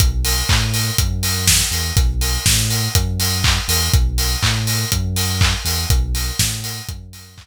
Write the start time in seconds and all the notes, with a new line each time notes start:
0.00 B1, kick, closed hi-hat
0.25 open hi-hat
0.49 A2, kick, clap
0.74 open hi-hat
0.98 F#2, kick, closed hi-hat
1.23 open hi-hat
1.48 kick, snare
1.71 E2, open hi-hat
1.96 B1, kick, closed hi-hat
2.21 open hi-hat
2.46 A2, kick, snare
2.70 open hi-hat
2.95 F#2, kick, closed hi-hat
3.20 open hi-hat
3.44 kick, clap
3.68 E2, open hi-hat
3.93 B1, kick, closed hi-hat
4.18 open hi-hat
4.43 A2, kick, clap
4.67 open hi-hat
4.92 F#2, kick, closed hi-hat
5.16 open hi-hat
5.41 kick, clap
5.65 E2, open hi-hat
5.89 B1, kick, closed hi-hat
6.15 open hi-hat
6.39 A2, kick, snare
6.64 open hi-hat
6.89 F#2, kick, closed hi-hat
7.13 open hi-hat
7.38 kick, clap